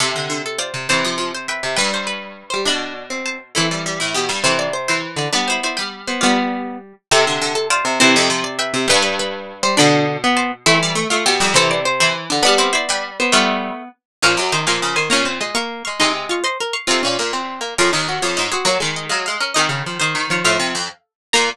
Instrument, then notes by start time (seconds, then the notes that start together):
pizzicato strings
0.00 C3 G4 A4 E5
0.15 D3
0.29 D3
0.46 A4
0.58 F4 C5 D5
0.74 C3
0.89 C3 E3 C5 A5
1.04 F3
1.17 F3
1.35 C5
1.48 B4 E5 G5
1.63 C3
1.76 G2 G3 B4 G5
1.94 C5
2.07 B4
2.50 G3 C5
2.65 B2 D4 D5 B5
3.10 C4
3.26 C5 A5
3.55 E3 A3 C4 E4 A4
3.71 G3
3.86 G3
4.00 A2 E4
4.14 B2 B3 G4
4.28 G2 G3
4.44 C3 E3 C4 A4 C5
4.59 D5
4.73 C5
4.88 E3 E4 C5
5.16 D3 D5
5.32 G3 B3 D4 B4 D5
5.48 E4 C5
5.63 E4 C5 D5
5.77 G3 B4 G5
6.07 B3 C5
6.21 G3 B3 F4 D5
7.11 C3 G4 A4 E5
7.27 D3
7.41 D3
7.55 A4
7.70 F4 C5 D5
7.85 C3
8.00 C3 E3 C4 C5 A5
8.15 F2
8.29 F3
8.44 D5
8.59 B4 E5 G5
8.74 C3
8.88 G2 G3 B4 G5
9.02 B4
9.19 B4
9.63 G3 C5
9.77 B2 D3 D4 D5 B5
10.24 B3
10.37 C5 A5
10.66 E3 A3 C4 E4 A4
10.82 G3
10.95 A3
11.10 A3 F4
11.25 B2 B3 G4
11.40 F2 G3
11.54 C3 E3 C4 A4 C5
11.71 D5
11.85 C5
12.00 E3 E4 C5
12.30 D3 D4
12.43 G3 B3 D4 B4 D5
12.58 C4 E4 C5
12.73 E4 C5 D5
12.88 G3 B4 G5
13.20 B3 C5
13.32 G3 A3 B3 F4 D5
14.22 A#2 F3 C#4 A#4 F5
14.37 F#2 F#3
14.52 D#3 D#4 C5
14.66 A#2 F3 G#4 A#4 F5
14.82 C#3
14.96 D#3 C5 G#5
15.10 A#2 A#3 C#4 C#5 A#5
15.25 C4
15.41 G#3 D#5 C6
15.55 A#3 F5 C#6
15.85 G#3 F5 C#6
16.00 C3 G#3 D#4 D#5 C6
16.29 F4 F5 C#6
16.44 C5 D#5 C6
16.60 A#4
16.73 F5 C#6
16.87 C3 C4 F4 A4 F5
17.03 A#2 C#4
17.18 A#2 A#3
17.33 C4
17.61 A#3
17.78 F2 C#4 F4 A#4
17.92 D#2 D#4
18.08 F#4
18.22 F2 F4 C#5
18.37 G#2 D#4 C5
18.52 C4 F#4 G#4
18.65 F#3 A#3 F#4 C#5
18.80 D#3 G#3
18.96 D#5
19.09 F#3 G#3 F5
19.26 G#3 F5
19.40 C#4 A#4
19.54 D#3 C4 G#4 D#5
19.69 C#3
19.86 F3
20.00 D#3 D#4 C5
20.15 D#3
20.30 F3 F4 C#5
20.44 A2 F3 A4 F5
20.59 C3
20.74 F2
21.33 A#2 A#3 A#4 A#5